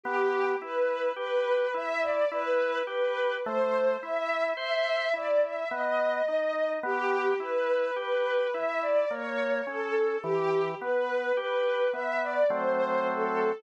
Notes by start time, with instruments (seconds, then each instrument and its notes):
0.03 drawbar organ B3, string ensemble 1 G4
0.62 drawbar organ E4, string ensemble 1 B4
1.16 drawbar organ G4, string ensemble 1 B4
1.74 drawbar organ E4, string ensemble 1 E5
2.01 string ensemble 1 D5
2.31 drawbar organ E4, string ensemble 1 B4
2.87 drawbar organ G4, string ensemble 1 B4
3.45 drawbar organ A3, string ensemble 1 C5
4.01 drawbar organ E4, string ensemble 1 E5
4.57 drawbar organ C5, string ensemble 1 E5
5.13 drawbar organ E4, string ensemble 1 D5
5.42 string ensemble 1 E5
5.71 drawbar organ B3, string ensemble 1 D#5
6.28 drawbar organ D#4
6.83 drawbar organ B3, string ensemble 1 G4
7.40 drawbar organ E4, string ensemble 1 B4
7.96 drawbar organ G4, string ensemble 1 B4
8.52 drawbar organ E4, string ensemble 1 E5
8.81 string ensemble 1 D5
9.09 drawbar organ A#3, string ensemble 1 C#5
9.67 drawbar organ C#4, string ensemble 1 A4
10.22 drawbar organ E3, string ensemble 1 G4
10.81 drawbar organ B3, string ensemble 1 B4
11.37 drawbar organ G4, string ensemble 1 B4
11.93 drawbar organ B3, string ensemble 1 E5
12.22 string ensemble 1 D5
12.50 drawbar organ F#3 A3 C4, string ensemble 1 C5
13.08 string ensemble 1 A4